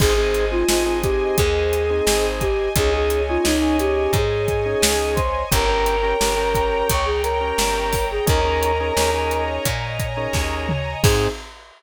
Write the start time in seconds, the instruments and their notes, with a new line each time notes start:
0.00 electric bass (finger) G#1, drawbar organ C4 D#4 G#4, choir aahs G#4, string ensemble 1 C5 D#5 G#5, kick, crash
0.15 drawbar organ C4 D#4 G#4, choir aahs G#4
0.34 closed hi-hat
0.51 drawbar organ C4 D#4 G#4, choir aahs F4
0.69 electric bass (finger) G#1, drawbar organ C4 D#4 G#4, choir aahs F4, snare
0.86 drawbar organ C4 D#4 G#4
1.02 choir aahs G4, kick, closed hi-hat
1.37 electric bass (finger) D#2, choir aahs G#4, kick, closed hi-hat
1.73 closed hi-hat
1.90 drawbar organ C4 D#4 G#4
2.07 electric bass (finger) G#1, snare
2.41 choir aahs G4, kick, closed hi-hat
2.76 electric bass (finger) C#2, drawbar organ C#4 D#4 G#4, choir aahs G#4, string ensemble 1 C#5 D#5 G#5, kick, closed hi-hat
2.93 drawbar organ C#4 D#4 G#4, choir aahs G#4
3.10 closed hi-hat
3.29 drawbar organ C#4 D#4 G#4, choir aahs F4
3.44 electric bass (finger) C#2, drawbar organ C#4 D#4 G#4, choir aahs D#4, snare
3.61 drawbar organ C#4 D#4 G#4
3.79 choir aahs G4, closed hi-hat
4.13 electric bass (finger) G#2, choir aahs G#4, kick, closed hi-hat
4.48 kick, closed hi-hat
4.66 drawbar organ C#4 D#4 G#4
4.82 electric bass (finger) C#2, snare
5.15 choir aahs C5, kick, closed hi-hat
5.51 electric bass (finger) G1, drawbar organ C#4 G4 A#4, choir aahs A#4, string ensemble 1 C#5 G5 A#5, kick, closed hi-hat
5.68 drawbar organ C#4 G4 A#4
5.86 closed hi-hat
6.03 drawbar organ C#4 G4 A#4
6.20 electric bass (finger) G1, drawbar organ C#4 G4 A#4, snare
6.37 drawbar organ C#4 G4 A#4
6.55 kick, closed hi-hat
6.90 electric bass (finger) C#2, choir aahs C#5, kick, closed hi-hat
7.06 choir aahs G#4
7.23 choir aahs A#4, closed hi-hat
7.41 drawbar organ C#4 G4 A#4
7.58 electric bass (finger) G1, snare
7.93 kick, open hi-hat
8.11 choir aahs G#4
8.26 electric bass (finger) D#2, drawbar organ C#4 D#4 G#4 A#4, choir aahs A#4, string ensemble 1 C#5 D#5 G#5 A#5, kick, closed hi-hat
8.45 drawbar organ C#4 D#4 G#4 A#4
8.63 closed hi-hat
8.80 drawbar organ C#4 D#4 G#4 A#4
8.97 electric bass (finger) D#2, drawbar organ C#4 D#4 G#4 A#4, snare
9.13 drawbar organ C#4 D#4 G#4 A#4
9.31 closed hi-hat
9.65 electric bass (finger) A#2, kick, closed hi-hat
9.99 kick, closed hi-hat
10.17 drawbar organ C#4 D#4 G#4 A#4
10.33 electric bass (finger) D#2, kick, snare
10.69 mid tom
11.03 electric bass (finger) G#2, string ensemble 1 C4 D#4 G#4, drawbar organ C4 D#4 G#4, choir aahs G#4, kick, crash